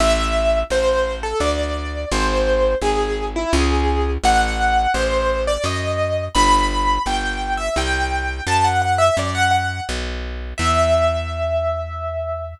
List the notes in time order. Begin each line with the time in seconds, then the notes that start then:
0.00 A1 E5
0.70 A1 C5
1.23 A4
1.40 D2 D5
2.11 G#1 C5
2.81 G#1 G#4
3.36 E4
3.53 C#2 G#4
4.24 A1 F#5
4.94 A1 C5
5.47 D5
5.64 F#2 D#5
6.34 G1 B5
7.06 G1 G5
7.57 E5
7.76 C2 G5
8.47 F#2 A5
8.64 F#5
8.82 F#5
8.98 E5
9.17 F#2 D5
9.34 F#5
9.51 F#5
9.89 B1
10.58 E2 E5